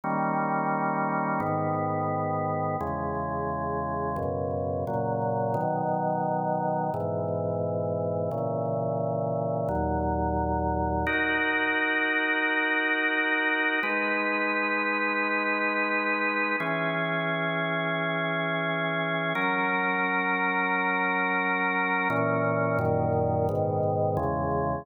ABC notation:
X:1
M:4/4
L:1/8
Q:1/4=87
K:G#m
V:1 name="Drawbar Organ"
[D,=G,A,C]4 [^G,,D,B,]4 | [E,,C,G,]4 [F,,B,,C,]2 [A,,C,F,]2 | [B,,D,F,]4 [G,,B,,E,]4 | [A,,C,E,]4 [D,,A,,F,]4 |
[K:B] [DFA]8 | [G,DB]8 | [E,CG]8 | [F,CA]8 |
[A,,E,C]2 [F,,A,,D,]2 [G,,B,,D,]2 [E,,C,G,]2 |]